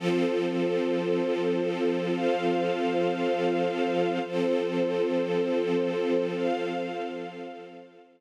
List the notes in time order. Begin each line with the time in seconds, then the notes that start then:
0.00 F3 C4 F4 A4 C5
2.12 F4 C5 F5
4.22 F3 C4 F4 A4 C5
6.35 F4 C5 F5